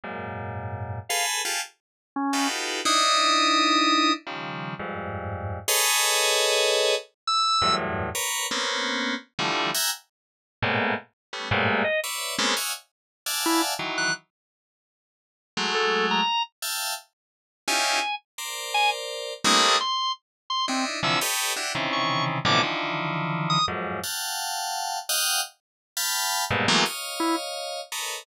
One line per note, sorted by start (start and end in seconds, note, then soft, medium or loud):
0.04 0.99 F#2 medium
0.04 0.99 G#2 medium
0.04 0.99 A#2 medium
1.09 1.42 G#4 medium
1.09 1.42 A4 medium
1.09 1.42 B4 medium
1.09 1.25 F5 medium
1.45 1.61 F4 medium
1.45 1.61 G4 medium
1.45 1.61 G#4 medium
1.45 1.61 A4 medium
2.16 2.48 C#4 medium
2.33 2.81 D#4 medium
2.33 2.81 F4 medium
2.33 2.81 F#4 medium
2.33 2.81 G4 medium
2.33 2.81 A4 medium
2.33 2.81 B4 medium
2.85 4.12 D4 loud
2.85 4.12 D#4 loud
2.85 4.12 E4 loud
2.85 4.13 D#6 loud
4.27 4.74 C#3 soft
4.27 4.74 D#3 soft
4.27 4.74 F3 soft
4.27 4.74 G3 soft
4.79 5.59 F2 medium
4.79 5.59 G2 medium
4.79 5.59 G#2 medium
5.68 6.95 G#4 loud
5.68 6.95 A4 loud
5.68 6.95 B4 loud
5.68 6.95 C#5 loud
5.68 6.95 D#5 loud
7.27 7.75 E6 loud
7.62 8.09 E2 medium
7.62 8.09 F#2 medium
7.62 8.09 G2 medium
7.62 8.09 A2 medium
8.15 8.47 A#4 medium
8.15 8.47 B4 medium
8.15 8.47 C#5 medium
8.51 9.15 A#3 medium
8.51 9.15 B3 medium
8.51 9.15 C4 medium
8.51 9.15 C#4 medium
9.39 9.71 D3 medium
9.39 9.71 E3 medium
9.39 9.71 F3 medium
9.39 9.71 G3 medium
9.39 9.71 A3 medium
9.74 9.90 E5 medium
9.74 9.90 F#5 medium
9.74 9.90 G5 medium
9.74 9.90 G#5 medium
9.74 9.90 A#5 medium
10.62 10.94 G#2 loud
10.62 10.94 A2 loud
10.62 10.94 A#2 loud
10.62 10.94 B2 loud
11.33 11.49 G3 medium
11.33 11.49 A3 medium
11.33 11.49 B3 medium
11.33 11.49 C#4 medium
11.51 11.83 G2 loud
11.51 11.83 G#2 loud
11.51 11.83 A2 loud
11.51 11.83 A#2 loud
11.84 12.00 D#5 medium
12.04 12.35 B4 medium
12.04 12.35 C#5 medium
12.04 12.35 D5 medium
12.04 12.35 E5 medium
12.38 12.54 G#3 loud
12.38 12.54 A#3 loud
12.38 12.54 B3 loud
12.38 12.54 C4 loud
12.38 12.54 C#4 loud
12.57 12.72 C#5 medium
12.57 12.72 D#5 medium
12.57 12.72 E5 medium
12.57 12.72 F5 medium
12.57 12.72 F#5 medium
12.57 12.72 G#5 medium
13.26 13.74 D5 medium
13.26 13.74 E5 medium
13.26 13.74 F5 medium
13.26 13.74 F#5 medium
13.26 13.74 G#5 medium
13.26 13.74 A5 medium
13.46 13.62 E4 loud
13.79 14.11 D#3 medium
13.79 14.11 E3 medium
13.79 14.11 F#3 medium
13.98 14.14 F#6 medium
15.57 16.21 F#3 medium
15.57 16.21 G#3 medium
15.57 16.21 A3 medium
15.75 16.06 A4 medium
16.11 16.43 A#5 medium
16.62 16.94 E5 medium
16.62 16.94 F5 medium
16.62 16.94 G5 medium
16.62 16.94 A5 medium
17.68 17.99 C#4 medium
17.68 17.99 D#4 medium
17.68 17.99 E4 medium
17.68 17.99 F4 medium
17.68 17.99 G4 medium
17.68 18.15 G#5 medium
18.38 19.33 A#4 medium
18.38 19.33 C5 medium
18.38 19.33 D5 medium
18.74 18.90 G#5 loud
19.44 19.76 G3 loud
19.44 19.76 A3 loud
19.44 19.76 A#3 loud
19.44 19.76 C4 loud
19.44 19.76 D4 loud
19.44 19.76 E4 loud
19.44 19.78 D#6 medium
19.81 20.12 C6 medium
20.50 20.66 C6 medium
20.68 20.85 C4 medium
20.68 21.00 D4 medium
20.68 21.00 D#4 medium
20.68 21.00 E4 medium
21.03 21.19 C3 loud
21.03 21.19 D3 loud
21.03 21.19 E3 loud
21.03 21.19 F3 loud
21.03 21.20 E6 medium
21.21 21.53 G4 medium
21.21 21.53 A4 medium
21.21 21.53 B4 medium
21.21 21.53 C#5 medium
21.21 21.53 D#5 medium
21.56 21.72 D4 medium
21.56 21.72 E4 medium
21.56 21.72 F#4 medium
21.56 21.72 G4 medium
21.75 22.38 C3 medium
21.75 22.38 C#3 medium
21.75 22.38 D#3 medium
21.75 22.38 E3 medium
21.93 22.24 C#6 medium
22.45 22.61 A2 loud
22.45 22.61 B2 loud
22.45 22.61 C3 loud
22.45 22.61 D3 loud
22.45 22.61 E3 loud
22.45 22.61 F3 loud
22.45 22.62 D6 medium
22.63 23.58 D3 medium
22.63 23.58 D#3 medium
22.63 23.58 E3 medium
22.63 23.58 F3 medium
23.50 23.66 D#6 loud
23.68 24.00 F2 medium
23.68 24.00 F#2 medium
23.68 24.00 G#2 medium
24.03 24.99 F5 medium
24.03 24.99 F#5 medium
24.03 24.99 G5 medium
24.03 24.99 A5 medium
25.09 25.41 D#5 medium
25.09 25.41 F5 medium
25.09 25.41 F#5 medium
25.09 25.41 G5 medium
25.97 26.44 F5 medium
25.97 26.44 G5 medium
25.97 26.44 A5 medium
25.97 26.44 B5 medium
26.51 26.66 G2 loud
26.51 26.66 G#2 loud
26.51 26.66 A#2 loud
26.51 26.66 B2 loud
26.68 26.84 E3 loud
26.68 26.84 F#3 loud
26.68 26.84 G#3 loud
26.68 26.84 A3 loud
26.68 26.84 A#3 loud
26.68 26.84 B3 loud
26.85 27.81 C#5 medium
26.85 27.81 D#5 medium
26.85 27.81 F5 medium
27.20 27.36 E4 loud
27.92 28.24 A4 medium
27.92 28.24 A#4 medium
27.92 28.24 B4 medium
27.92 28.24 C#5 medium
27.92 28.24 D#5 medium